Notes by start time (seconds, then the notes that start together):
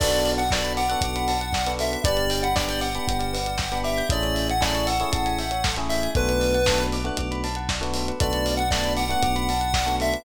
0.00 B1 B3 D4 F#4 A4 D5, kick, crash
0.12 B4, closed hi-hat
0.25 D5, open hi-hat
0.38 F#5, closed hi-hat
0.51 B3 D4 F#4 A4 D5 A5, kick, snare
0.64 B5, closed hi-hat
0.77 F#5 D6, open hi-hat
0.89 B3 D4 F#4 A4 F#6, closed hi-hat
1.01 B1 D6, kick, closed hi-hat
1.16 B5, closed hi-hat
1.28 A5, open hi-hat
1.41 F#5, closed hi-hat
1.53 D5, kick, snare
1.67 B3 D4 F#4 A4 B4, closed hi-hat
1.79 A4 E5, open hi-hat
1.92 B4, closed hi-hat
2.04 G1 B3 D4 G4 B4 D5, kick, closed hi-hat
2.17 D5, closed hi-hat
2.30 G5, open hi-hat
2.43 F#5 B5, closed hi-hat
2.56 B3 D4 G4 D5 D6, kick, snare
2.69 G6, closed hi-hat
2.81 F#5 D6, open hi-hat
2.95 B3 D4 G4 B5, closed hi-hat
3.08 G1 G5, kick, closed hi-hat
3.19 D5, closed hi-hat
3.33 B4, open hi-hat
3.46 D5, closed hi-hat
3.58 G5, kick, snare
3.72 B3 D4 G4 B5, closed hi-hat
3.84 E5 D6, open hi-hat
3.98 G6, closed hi-hat
4.10 A1 A3 C#4 E4 G#4 A4 D5, kick, closed hi-hat
4.22 C#5, closed hi-hat
4.35 E5, open hi-hat
4.49 F#5 G#5, closed hi-hat
4.61 A3 C#4 E4 G#4 D5 A5, kick, snare
4.74 C#6, closed hi-hat
4.87 F#5 E6, open hi-hat
5.00 A3 C#4 E4 G#4 C#6, closed hi-hat
5.12 A1 A5, kick, closed hi-hat
5.26 G#5, closed hi-hat
5.38 E5, open hi-hat
5.51 C#5, closed hi-hat
5.64 A4, kick, snare
5.76 A3 C#4 E4 G#4 C#5, closed hi-hat
5.89 E5, open hi-hat
6.03 G#5, closed hi-hat
6.15 B1 A3 B3 D4 F#4 A4 B4, kick, closed hi-hat
6.28 B4, closed hi-hat
6.40 D5, open hi-hat
6.54 F#5, closed hi-hat
6.66 A3 B3 D4 F#4 A5, kick, snare
6.78 B5, closed hi-hat
6.92 D6, open hi-hat
7.04 A3 B3 D4 F#4 F#6, closed hi-hat
7.17 B1 D6, kick, closed hi-hat
7.31 B5, closed hi-hat
7.44 A5, open hi-hat
7.55 F#5, closed hi-hat
7.69 D5, kick, snare
7.81 A3 B3 D4 F#4 B4, closed hi-hat
7.94 A4, open hi-hat
8.08 B4, closed hi-hat
8.20 B1 A3 B3 D4 F#4 A4 D5, kick, closed hi-hat
8.33 B4, closed hi-hat
8.46 D5, open hi-hat
8.57 F#5, closed hi-hat
8.71 A3 B3 D4 F#4 D5 A5, kick, snare
8.84 B5, closed hi-hat
8.97 F#5 D6, open hi-hat
9.09 A3 B3 D4 F#4 F#6, closed hi-hat
9.23 B1 D6, kick, closed hi-hat
9.36 B5, closed hi-hat
9.49 A5, open hi-hat
9.61 F#5, closed hi-hat
9.74 D5, kick, snare
9.86 A3 B3 D4 F#4 B4, closed hi-hat
10.00 A4 E5, open hi-hat
10.13 B4, closed hi-hat